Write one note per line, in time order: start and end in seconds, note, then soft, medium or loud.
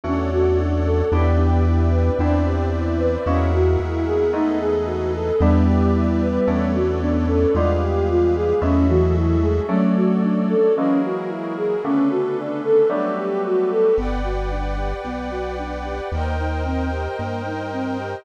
0.04 1.03 E2 loud
0.04 1.00 A3 medium
0.04 1.00 C#4 medium
0.04 0.30 C#4 medium
0.04 1.00 D4 loud
0.04 1.00 F#4 medium
0.04 1.11 A4 medium
0.04 1.11 C#5 medium
0.04 1.11 D5 medium
0.04 1.11 F#5 medium
0.31 0.56 F#4 medium
0.59 0.83 D4 medium
0.86 1.10 A4 medium
1.12 2.10 E2 loud
1.12 2.10 B3 medium
1.12 2.09 B3 medium
1.12 2.10 D4 medium
1.12 1.37 D4 medium
1.12 2.09 D4 medium
1.12 2.09 E4 medium
1.12 2.09 G4 medium
1.12 2.18 B4 medium
1.12 2.18 D5 medium
1.12 2.18 E5 medium
1.12 2.18 G5 medium
1.38 1.63 G4 medium
1.66 1.90 E4 soft
1.92 2.16 B4 soft
2.19 3.17 E2 loud
2.19 3.16 B3 medium
2.19 3.16 C4 medium
2.19 2.43 D4 medium
2.19 3.16 D4 medium
2.19 3.16 E4 medium
2.19 3.25 B4 medium
2.19 3.25 C5 medium
2.19 3.25 D5 medium
2.19 3.25 E5 medium
2.46 2.70 G4 soft
2.73 2.97 E4 soft
2.98 3.23 B4 soft
3.26 3.77 E2 loud
3.26 4.23 G#3 medium
3.26 4.23 A#3 medium
3.26 3.51 C#4 medium
3.26 4.23 E4 loud
3.26 4.23 F#4 medium
3.26 4.33 G#4 medium
3.26 4.33 A#4 medium
3.26 4.33 E5 medium
3.26 4.33 F#5 medium
3.53 3.77 F#4 medium
3.80 5.32 E2 loud
3.80 4.04 E4 soft
4.06 4.31 G#4 medium
4.33 5.29 G#3 medium
4.33 5.29 A3 medium
4.33 5.29 B3 medium
4.33 5.29 D#4 medium
4.33 4.59 D#4 medium
4.33 5.41 G#4 medium
4.33 5.41 A4 medium
4.33 5.40 B4 medium
4.33 5.41 D#5 medium
4.60 4.85 G#4 medium
4.86 5.11 F#4 soft
5.14 5.38 A4 medium
5.40 6.39 E2 loud
5.40 6.77 G3 medium
5.40 6.38 G3 medium
5.40 6.77 B3 medium
5.40 6.38 B3 medium
5.40 5.65 D4 medium
5.40 6.38 D4 medium
5.40 6.38 E4 medium
5.40 6.46 G4 medium
5.40 6.46 B4 medium
5.40 6.46 D5 medium
5.40 6.46 E5 medium
5.67 5.91 G4 medium
5.94 6.19 E4 soft
6.21 6.46 B4 soft
6.47 7.46 E2 loud
6.47 7.44 A3 medium
6.47 7.44 B3 medium
6.47 6.71 C#4 medium
6.47 7.44 C#4 medium
6.47 7.44 D4 medium
6.47 7.54 A4 medium
6.47 7.54 B4 medium
6.47 7.54 C#5 medium
6.47 7.54 D5 medium
6.74 6.99 F#4 medium
7.01 7.26 B3 medium
7.01 7.26 D4 medium
7.27 7.53 C#4 medium
7.27 7.52 A4 soft
7.54 8.53 E2 loud
7.54 8.52 G3 medium
7.54 8.59 G#3 medium
7.54 8.52 G#3 medium
7.54 8.52 B3 medium
7.54 7.79 D4 medium
7.54 8.52 F4 medium
7.54 8.62 G4 medium
7.54 8.62 G#4 medium
7.54 8.62 B4 medium
7.54 8.62 F5 medium
7.81 8.06 G4 medium
8.09 8.34 F4 soft
8.35 8.60 G#4 medium
8.61 9.60 E2 loud
8.61 9.58 F#3 medium
8.61 9.58 G#3 medium
8.61 9.58 A3 loud
8.61 8.86 C#4 medium
8.61 9.58 E4 medium
8.61 9.67 F#4 medium
8.61 9.69 G#4 medium
8.61 9.67 A4 medium
8.61 9.69 E5 medium
8.88 9.37 E3 medium
8.88 9.13 F#4 medium
9.15 9.40 E4 soft
9.42 9.67 G#3 medium
9.42 9.67 G#4 soft
9.68 10.65 F#3 medium
9.68 10.55 F#3 medium
9.68 10.65 A3 medium
9.68 10.55 A3 loud
9.68 10.65 C#4 medium
9.68 9.93 C#4 medium
9.68 10.65 D4 medium
9.68 10.74 F#4 medium
9.68 10.74 A4 medium
9.68 10.74 C#5 medium
9.68 10.74 D5 medium
9.96 10.20 F#4 soft
10.23 10.48 D4 medium
10.49 10.74 A4 medium
10.75 11.74 E3 medium
10.75 11.74 F#3 medium
10.75 11.74 G#3 medium
10.75 11.74 A#3 medium
10.75 11.00 C#4 medium
10.75 11.83 E4 medium
10.75 11.83 F#4 medium
10.75 11.83 G#4 medium
10.75 11.83 A#4 medium
11.04 11.28 F#4 soft
11.29 11.54 E4 medium
11.57 11.82 G#4 medium
11.83 12.81 C#3 medium
11.83 12.81 D3 medium
11.83 12.81 A3 medium
11.83 12.81 B3 medium
11.83 12.89 C#4 medium
11.83 12.08 C#4 medium
11.83 12.89 D4 medium
11.83 12.89 A4 medium
11.83 12.89 B4 medium
12.10 12.35 F#4 medium
12.37 12.62 D4 medium
12.64 12.88 A4 medium
12.89 13.86 F#3 medium
12.89 13.86 G3 loud
12.89 13.86 A3 medium
12.89 13.86 B3 medium
12.89 13.15 D4 medium
12.89 13.96 F#4 medium
12.89 13.96 G4 medium
12.89 13.96 A4 medium
12.89 13.95 B4 medium
13.17 13.42 G4 soft
13.44 13.69 F#4 medium
13.71 13.96 A4 medium
13.96 14.94 G1 medium
13.96 14.22 B3 medium
13.96 16.08 B4 medium
13.96 16.08 D5 medium
13.96 16.08 F#5 medium
13.96 16.08 G5 medium
14.24 14.49 F#4 medium
14.51 14.76 D4 medium
14.77 15.02 G4 medium
15.05 16.01 B1 medium
15.05 15.30 B3 medium
15.31 15.55 F#4 medium
15.59 15.83 D4 medium
15.85 16.10 G4 medium
16.12 17.08 D#2 medium
16.12 16.37 A#3 medium
16.12 18.24 A#4 medium
16.12 18.24 C5 medium
16.12 18.24 D#5 medium
16.12 18.24 G5 medium
16.39 16.63 D#4 medium
16.65 16.90 C4 medium
16.92 17.17 G4 medium
17.19 18.16 G2 medium
17.19 17.43 A#3 medium
17.46 17.70 D#4 medium
17.73 17.97 C4 medium
17.99 18.24 G4 medium